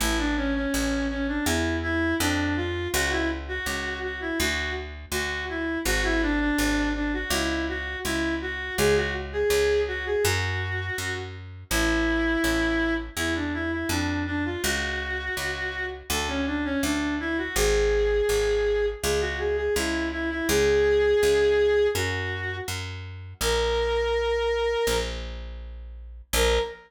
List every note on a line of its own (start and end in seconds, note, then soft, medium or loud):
0.00 0.66 A1 medium
0.00 0.17 E4 medium
0.18 0.35 D4 medium
0.37 0.54 C#4 medium
0.55 1.07 C#4 medium
0.74 1.40 A1 medium
1.10 1.27 C#4 medium
1.28 1.45 D4 medium
1.46 2.14 E2 medium
1.46 1.77 E4 medium
1.83 2.15 E4 medium
2.19 2.87 F2 loud
2.19 2.55 D4 medium
2.56 2.88 F4 medium
2.93 3.60 C#2 loud
2.93 3.10 F#4 loud
3.11 3.29 E4 medium
3.48 3.99 F#4 medium
3.66 4.32 C#2 medium
4.03 4.20 F#4 medium
4.21 4.38 E4 medium
4.39 5.05 D2 medium
4.39 4.71 F#4 medium
5.12 5.77 D2 medium
5.12 5.45 F#4 medium
5.49 5.79 E4 medium
5.85 6.51 G#1 medium
5.85 6.03 F#4 medium
6.04 6.21 E4 medium
6.22 6.39 D4 medium
6.40 6.89 D4 medium
6.58 7.24 G#1 medium
6.95 7.12 D4 medium
7.13 7.31 F#4 medium
7.30 7.96 C#2 loud
7.30 7.65 E4 medium
7.69 7.99 F#4 medium
8.04 8.71 C#2 medium
8.04 8.34 E4 medium
8.41 8.75 F#4 medium
8.78 9.44 C#2 medium
8.78 8.95 G#4 medium
8.96 9.14 F#4 medium
9.33 9.81 G#4 medium
9.50 10.16 C#2 medium
9.88 10.05 F#4 medium
10.06 10.23 G#4 medium
10.24 10.90 F#2 loud
10.24 11.15 F#4 medium
10.98 11.64 F#2 medium
11.70 12.37 A1 medium
11.70 12.94 E4 medium
12.44 13.10 A1 medium
13.17 13.84 E2 medium
13.17 13.34 E4 medium
13.35 13.53 D4 medium
13.54 13.71 E4 medium
13.72 13.89 E4 medium
13.89 14.57 F2 medium
13.89 14.23 D4 medium
14.27 14.44 D4 medium
14.45 14.62 F4 medium
14.63 15.30 C#2 loud
14.63 15.85 F#4 medium
15.37 16.03 C#2 medium
16.10 16.76 D2 medium
16.10 16.28 A4 medium
16.28 16.45 C#4 medium
16.46 16.64 D4 medium
16.64 16.82 C#4 medium
16.83 17.49 D2 medium
16.83 17.15 D4 medium
17.20 17.37 E4 medium
17.38 17.55 F#4 medium
17.56 18.22 G#1 loud
17.56 18.86 G#4 medium
18.29 18.95 G#1 medium
19.03 19.69 C#2 medium
19.03 19.20 G#4 medium
19.21 19.38 F#4 medium
19.39 19.56 G#4 medium
19.57 19.74 G#4 medium
19.76 20.42 C#2 medium
19.76 20.07 E4 medium
20.12 20.29 E4 medium
20.30 20.48 E4 medium
20.48 21.15 C#2 medium
20.48 21.87 G#4 medium
21.23 21.89 C#2 medium
21.95 22.61 F#2 medium
21.95 22.56 F#4 medium
22.68 23.34 F#2 medium
23.41 24.75 A#1 medium
23.41 24.97 A#4 medium
24.87 26.22 A#1 medium
26.33 26.59 A#1 loud
26.33 26.60 A#4 loud